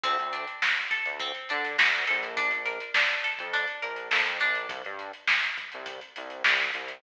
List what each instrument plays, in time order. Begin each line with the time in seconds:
0.04 synth bass 1 D2, acoustic guitar (steel) C4, kick, closed hi-hat
0.19 synth bass 1 D2, closed hi-hat
0.33 acoustic guitar (steel) D4, closed hi-hat
0.47 closed hi-hat
0.62 acoustic guitar (steel) F#4, snare
0.77 closed hi-hat
0.91 acoustic guitar (steel) A4, kick, closed hi-hat
1.06 synth bass 1 D2, closed hi-hat
1.20 acoustic guitar (steel) C4, kick, closed hi-hat
1.34 closed hi-hat
1.49 synth bass 1 D3, acoustic guitar (steel) D4, closed hi-hat
1.64 snare, closed hi-hat
1.78 synth bass 1 D2, acoustic guitar (steel) F#4, snare
1.92 closed hi-hat
2.07 synth bass 1 A#1, acoustic guitar (steel) A4, closed hi-hat
2.23 closed hi-hat
2.37 acoustic guitar (steel) D4, kick, closed hi-hat
2.51 synth bass 1 A#1, closed hi-hat
2.66 acoustic guitar (steel) A#4, closed hi-hat
2.80 closed hi-hat
2.94 acoustic guitar (steel) D4, snare
3.09 closed hi-hat
3.24 acoustic guitar (steel) A4, closed hi-hat
3.39 synth bass 1 F2, kick, closed hi-hat
3.53 acoustic guitar (steel) D4, kick, closed hi-hat
3.67 closed hi-hat
3.82 synth bass 1 A#1, acoustic guitar (steel) A#4, closed hi-hat
3.96 closed hi-hat
4.11 synth bass 1 F2, acoustic guitar (steel) A4, snare
4.26 closed hi-hat
4.40 synth bass 1 A#1, acoustic guitar (steel) D4, closed hi-hat
4.55 closed hi-hat
4.69 synth bass 1 C2, kick, closed hi-hat
4.84 synth bass 1 G2, closed hi-hat
4.99 closed hi-hat
5.13 closed hi-hat
5.27 snare
5.42 closed hi-hat
5.57 kick, closed hi-hat
5.72 synth bass 1 C2, closed hi-hat
5.86 kick, closed hi-hat
6.01 closed hi-hat
6.16 synth bass 1 C2, closed hi-hat
6.30 closed hi-hat
6.44 synth bass 1 C2, snare
6.59 snare, closed hi-hat
6.74 synth bass 1 C2, closed hi-hat
6.87 snare, closed hi-hat